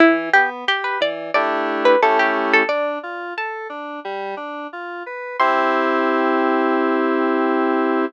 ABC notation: X:1
M:4/4
L:1/16
Q:1/4=89
K:C
V:1 name="Harpsichord"
E2 G z G B d2 d3 B A G z A | d4 a8 z4 | c'16 |]
V:2 name="Electric Piano 2"
E,2 B,2 G2 E,2 [A,DEG]4 [A,^CEG]4 | D2 F2 A2 D2 G,2 D2 F2 B2 | [CEG]16 |]